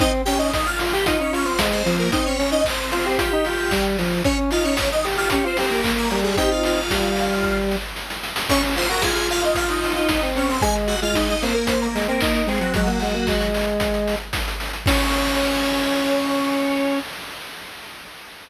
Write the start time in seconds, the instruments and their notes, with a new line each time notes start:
0.00 lead 1 (square) C4 D#4 D#5, kick, closed hi-hat
0.25 lead 1 (square) C#4 G4 G5, open hi-hat
0.39 lead 1 (square) D#4 D#5
0.53 lead 1 (square) D#4 D#5, kick, snare
0.66 lead 1 (square) F4 F5
0.79 lead 1 (square) F4, open hi-hat
0.92 lead 1 (square) G4 G5
1.06 lead 1 (square) D#4 F4 D#5, kick, closed hi-hat
1.19 lead 1 (square) C#4 D#4 C#5
1.33 lead 1 (square) C#4 F4 C#5, open hi-hat
1.45 lead 1 (square) C4 C5
1.59 lead 1 (square) G#3, kick, snare
1.72 lead 1 (square) C4 C5
1.85 lead 1 (square) F3, open hi-hat
1.99 lead 1 (square) A#3 A#4
2.12 lead 1 (square) C4 D#4 D#5, kick, closed hi-hat
2.26 lead 1 (square) C#4 C#5
2.39 lead 1 (square) C#4, open hi-hat
2.52 lead 1 (square) D#4 D#5
2.64 lead 1 (square) C4 C5, kick, clap
2.91 lead 1 (square) C4 F4 C5, open hi-hat
3.06 lead 1 (square) G4
3.18 lead 1 (square) F4 G4 G5, kick, closed hi-hat
3.33 lead 1 (square) D#4
3.45 lead 1 (square) F4, open hi-hat
3.71 lead 1 (square) G3, kick, clap
3.98 lead 1 (square) F3, open hi-hat
4.24 lead 1 (square) C#4 C#5, kick, closed hi-hat
4.51 lead 1 (square) D#4 F4 F5, open hi-hat
4.64 lead 1 (square) C#4 C#5
4.77 lead 1 (square) C#4 C#5, kick, snare
4.92 lead 1 (square) D#4 D#5
5.04 lead 1 (square) G4, open hi-hat
5.17 lead 1 (square) F4 G4 F5
5.30 lead 1 (square) C#4 G4 C#5, kick, closed hi-hat
5.44 lead 1 (square) C4 F4 C5
5.57 lead 1 (square) C4 G4 C5, open hi-hat
5.70 lead 1 (square) A#3 A#4
5.84 lead 1 (square) A#3, kick, clap
5.97 lead 1 (square) A#3 A#4
6.11 lead 1 (square) G3, open hi-hat
6.24 lead 1 (square) G#3 G#4
6.37 lead 1 (square) C4 D#4 G4 G5, kick, closed hi-hat
6.51 lead 1 (square) F4 F5
6.63 lead 1 (square) F4 F5, open hi-hat
6.90 lead 1 (square) G3, kick, snare
7.16 open hi-hat
7.43 kick, snare
7.71 snare
7.96 snare
8.10 snare
8.23 snare
8.36 snare
8.49 lead 1 (square) C#4 C#5 C#6, kick, crash
8.62 lead 1 (square) C#4, closed hi-hat
8.76 lead 1 (square) F4 C5 C6, open hi-hat
8.88 lead 1 (square) F#4 A#4 A#5, closed hi-hat
9.01 lead 1 (square) F4 G#4 G#5, kick, snare
9.15 lead 1 (square) G#4 G#5, closed hi-hat
9.29 lead 1 (square) F4 F5, open hi-hat
9.42 lead 1 (square) D#4 F4 D#5, closed hi-hat
9.55 lead 1 (square) F4 F5, kick, closed hi-hat
9.68 lead 1 (square) D#4 D#5, closed hi-hat
9.83 open hi-hat
9.95 lead 1 (square) D#4 F4 D#5, closed hi-hat
10.08 lead 1 (square) D#4, kick, snare
10.21 lead 1 (square) C4, closed hi-hat
10.35 lead 1 (square) C4 C#4 C#5, open hi-hat
10.49 lead 1 (square) C4 C5, open hi-hat
10.61 lead 1 (square) G#3 G#4 G#5, kick, closed hi-hat
10.75 closed hi-hat
10.87 lead 1 (square) F#4 F#5, open hi-hat
11.02 lead 1 (square) G#3 F4 F5, closed hi-hat
11.14 lead 1 (square) D#4 D#5, kick, snare
11.28 lead 1 (square) D#4 D#5, closed hi-hat
11.42 lead 1 (square) A#3 C4 C5, open hi-hat
11.54 lead 1 (square) A#3 A#4, closed hi-hat
11.67 lead 1 (square) C4 C5, kick, closed hi-hat
11.81 lead 1 (square) A#3 A#4, closed hi-hat
11.95 lead 1 (square) G#3, open hi-hat
12.08 lead 1 (square) A#3 C4 A#4, closed hi-hat
12.21 lead 1 (square) D#4, kick, clap
12.34 lead 1 (square) D#4, closed hi-hat
12.47 lead 1 (square) G#3 C4 G#4, open hi-hat
12.60 lead 1 (square) F#3 F#4, closed hi-hat
12.74 lead 1 (square) F#3 G#3 F#4, kick, closed hi-hat
12.87 lead 1 (square) A#3, closed hi-hat
13.00 lead 1 (square) G#3, open hi-hat
13.14 lead 1 (square) A#3, closed hi-hat
13.27 lead 1 (square) G#3, kick, clap
13.41 closed hi-hat
13.54 open hi-hat
13.67 closed hi-hat
13.80 kick, closed hi-hat
13.94 closed hi-hat
14.08 open hi-hat
14.20 closed hi-hat
14.33 kick, snare
14.48 closed hi-hat
14.60 open hi-hat
14.73 closed hi-hat
14.86 lead 1 (square) C#4 C#5, kick, crash